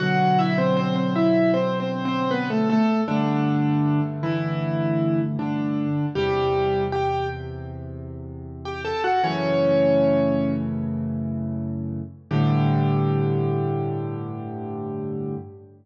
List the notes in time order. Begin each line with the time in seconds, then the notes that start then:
0.00 B2 D3 F#3 F#4 F#5
0.39 E4 E5
0.58 C4 C5
0.77 C4 C5
0.96 C4 C5
1.16 E4 E5
1.54 C4 C5
1.80 C4 C5
2.05 C4 C5
2.31 B3 B4
2.50 A3 A4
2.70 A3 A4
3.08 G2 D3 A3 D4
4.23 E3 E4
5.39 D3 D4
6.15 E2 C3 G3 G4
6.92 G4 G5
8.65 G4 G5
8.85 A4 A5
9.04 F#4 F#5
9.24 F#2 C#3 E3 A3 C#4 C#5
12.31 G2 A2 D3 G4